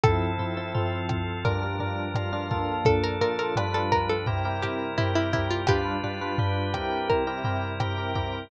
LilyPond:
<<
  \new Staff \with { instrumentName = "Pizzicato Strings" } { \time 4/4 \key f \major \tempo 4 = 85 a'8 r4. bes'2 | a'16 bes'16 bes'16 bes'16 r16 a'16 bes'16 a'16 r8 g'8 e'16 e'16 e'16 f'16 | g'8 r4. bes'2 | }
  \new Staff \with { instrumentName = "Electric Piano 1" } { \time 4/4 \key f \major <f c' e' a'>8 <f c' e' a'>16 <f c' e' a'>16 <f c' e' a'>4 <g d' f' bes'>16 <g d' f' bes'>16 <g d' f' bes'>8 <g d' f' bes'>16 <g d' f' bes'>16 <bes d' f' a'>8~ | <bes d' f' a'>8 <bes d' f' a'>16 <bes d' f' a'>16 <g d' f' b'>4 <c' e' g' bes'>16 <c' e' g' bes'>16 <c' e' g' bes'>8 <c' e' g' bes'>16 <c' e' g' bes'>16 <c' e' g' bes'>8 | <g d' f' b'>8 <g d' f' b'>16 <g d' f' b'>16 <g d' f' b'>8 <c' e' g' bes'>8. <c' e' g' bes'>16 <c' e' g' bes'>8 <c' e' g' bes'>16 <c' e' g' bes'>16 <c' e' g' bes'>8 | }
  \new Staff \with { instrumentName = "Drawbar Organ" } { \time 4/4 \key f \major <f c' e' a'>4 <f c' f' a'>4 <g, f d' bes'>4 <g, f f' bes'>4 | <bes, f d' a'>4 <g, f d' b'>4 <c g e' bes'>4 <c g g' bes'>4 | <g d' f' b'>4 <g d' g' b'>4 <c g e' bes'>4 <c g g' bes'>4 | }
  \new DrumStaff \with { instrumentName = "Drums" } \drummode { \time 4/4 <bd ss tomfh>8 tomfh8 tomfh8 <bd ss tomfh>8 <bd tomfh>8 tomfh8 <ss tomfh>8 <bd tomfh>8 | <bd tomfh>8 tomfh8 <ss tomfh>8 <bd tomfh>8 <bd tomfh>8 <ss tomfh>8 tomfh8 <bd tomfh>8 | <bd ss tomfh>8 tomfh8 tomfh8 <bd ss tomfh>8 bd8 tomfh8 <ss tomfh>8 <bd tomfh>8 | }
>>